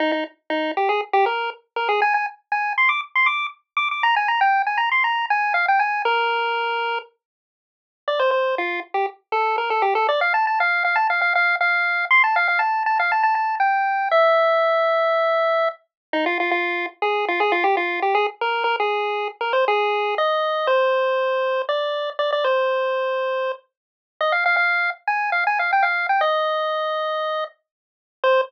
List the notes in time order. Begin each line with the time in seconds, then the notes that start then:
0.00 D#4
0.12 D#4
0.50 D#4
0.77 G4
0.89 G#4
1.13 G4
1.26 A#4
1.76 A#4
1.89 G#4
2.02 G#5
2.14 G#5
2.52 G#5
2.78 C6
2.89 D6
3.15 C6
3.26 D6
3.77 D6
3.91 D6
4.03 A#5
4.16 G#5
4.28 A#5
4.41 G5
4.66 G#5
4.78 A#5
4.91 C6
5.04 A#5
5.30 G#5
5.54 F5
5.68 G5
5.79 G#5
6.05 A#4
8.08 D5
8.20 C5
8.31 C5
8.58 F4
8.94 G4
9.32 A4
9.58 A#4
9.70 A4
9.82 G4
9.95 A4
10.09 D5
10.21 F5
10.34 A5
10.47 A5
10.60 F5
10.85 F5
10.96 A5
11.10 F5
11.21 F5
11.35 F5
11.61 F5
12.11 C6
12.24 A5
12.36 F5
12.48 F5
12.59 A5
12.86 A5
12.99 F5
13.12 A5
13.23 A5
13.35 A5
13.60 G5
14.11 E5
16.13 D#4
16.26 F4
16.40 F4
16.51 F4
17.02 G#4
17.28 F4
17.40 G#4
17.52 F4
17.64 G4
17.77 F4
18.02 G4
18.15 G#4
18.41 A#4
18.64 A#4
18.80 G#4
19.41 A#4
19.53 C5
19.68 G#4
20.18 D#5
20.67 C5
21.69 D5
22.19 D5
22.32 D5
22.44 C5
24.21 D#5
24.32 F5
24.46 F5
24.57 F5
25.07 G#5
25.32 F5
25.47 G#5
25.59 F5
25.73 G5
25.83 F5
26.09 G5
26.21 D#5
28.24 C5